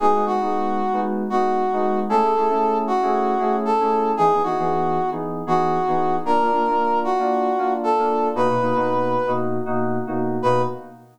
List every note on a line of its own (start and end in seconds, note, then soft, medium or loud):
0.00 0.12 G#3 medium
0.00 0.12 B3 medium
0.00 0.12 D#4 medium
0.00 0.12 F#4 medium
0.00 0.25 G#4 medium
0.15 0.24 G#3 medium
0.15 0.24 B3 medium
0.15 0.24 D#4 medium
0.15 0.24 F#4 medium
0.25 0.37 G#3 medium
0.25 0.37 B3 medium
0.25 0.37 D#4 medium
0.25 0.37 F#4 medium
0.25 1.00 F#4 medium
0.41 0.81 G#3 medium
0.41 0.81 B3 medium
0.41 0.81 D#4 medium
0.41 0.81 F#4 medium
0.93 1.23 G#3 medium
0.93 1.23 B3 medium
0.93 1.23 D#4 medium
0.93 1.23 F#4 medium
1.30 1.63 G#3 medium
1.30 1.63 B3 medium
1.30 1.63 D#4 medium
1.30 1.99 F#4 medium
1.30 1.63 F#4 medium
1.73 2.03 G#3 medium
1.73 2.03 B3 medium
1.73 2.03 D#4 medium
1.73 2.03 F#4 medium
2.09 2.21 A3 medium
2.09 2.21 C#4 medium
2.09 2.21 E4 medium
2.09 2.21 G#4 medium
2.09 2.78 A4 medium
2.22 2.31 A3 medium
2.22 2.31 C#4 medium
2.22 2.31 E4 medium
2.22 2.31 G#4 medium
2.35 2.47 A3 medium
2.35 2.47 C#4 medium
2.35 2.47 E4 medium
2.35 2.47 G#4 medium
2.50 2.90 A3 medium
2.50 2.90 C#4 medium
2.50 2.90 E4 medium
2.50 2.90 G#4 medium
2.87 3.56 F#4 medium
3.02 3.33 A3 medium
3.02 3.33 C#4 medium
3.02 3.33 E4 medium
3.02 3.33 G#4 medium
3.38 3.70 A3 medium
3.38 3.70 C#4 medium
3.38 3.70 E4 medium
3.38 3.70 G#4 medium
3.65 4.12 A4 medium
3.80 4.11 A3 medium
3.80 4.11 C#4 medium
3.80 4.11 E4 medium
3.80 4.11 G#4 medium
4.17 4.30 E3 medium
4.17 4.30 B3 medium
4.17 4.30 D#4 medium
4.17 4.42 G#4 loud
4.17 4.30 G#4 medium
4.33 4.42 E3 medium
4.33 4.42 B3 medium
4.33 4.42 D#4 medium
4.33 4.42 G#4 medium
4.43 4.55 E3 medium
4.43 4.55 B3 medium
4.43 4.55 D#4 medium
4.43 5.10 F#4 medium
4.43 4.55 G#4 medium
4.58 4.99 E3 medium
4.58 4.99 B3 medium
4.58 4.99 D#4 medium
4.58 4.99 G#4 medium
5.11 5.42 E3 medium
5.11 5.42 B3 medium
5.11 5.42 D#4 medium
5.11 5.42 G#4 medium
5.47 5.79 E3 medium
5.47 5.79 B3 medium
5.47 5.79 D#4 medium
5.47 6.16 F#4 medium
5.47 5.79 G#4 medium
5.88 6.18 E3 medium
5.88 6.18 B3 medium
5.88 6.18 D#4 medium
5.88 6.18 G#4 medium
6.25 6.37 A#3 medium
6.25 6.37 D4 medium
6.25 6.37 F4 medium
6.25 6.99 A#4 medium
6.41 6.50 A#3 medium
6.41 6.50 D4 medium
6.41 6.50 F4 medium
6.52 6.63 A#3 medium
6.52 6.63 D4 medium
6.52 6.63 F4 medium
6.67 7.07 A#3 medium
6.67 7.07 D4 medium
6.67 7.07 F4 medium
7.04 7.73 F#4 medium
7.18 7.49 A#3 medium
7.18 7.49 D4 medium
7.18 7.49 F4 medium
7.58 7.90 A#3 medium
7.58 7.90 D4 medium
7.58 7.90 F4 medium
7.83 8.29 A4 medium
7.98 8.29 A#3 medium
7.98 8.29 D4 medium
7.98 8.29 F4 medium
8.35 8.47 B2 medium
8.35 8.47 A#3 medium
8.35 8.47 D#4 medium
8.35 8.47 F#4 medium
8.35 9.31 B4 medium
8.49 8.58 B2 medium
8.49 8.58 A#3 medium
8.49 8.58 D#4 medium
8.49 8.58 F#4 medium
8.61 8.73 B2 medium
8.61 8.73 A#3 medium
8.61 8.73 D#4 medium
8.61 8.73 F#4 medium
8.75 9.15 B2 medium
8.75 9.15 A#3 medium
8.75 9.15 D#4 medium
8.75 9.15 F#4 medium
9.27 9.57 B2 medium
9.27 9.57 A#3 medium
9.27 9.57 D#4 medium
9.27 9.57 F#4 medium
9.66 9.98 B2 medium
9.66 9.98 A#3 medium
9.66 9.98 D#4 medium
9.66 9.98 F#4 medium
10.07 10.37 B2 medium
10.07 10.37 A#3 medium
10.07 10.37 D#4 medium
10.07 10.37 F#4 medium
10.42 10.63 B2 loud
10.42 10.63 A#3 loud
10.42 10.63 D#4 medium
10.42 10.63 F#4 medium
10.42 10.62 B4 loud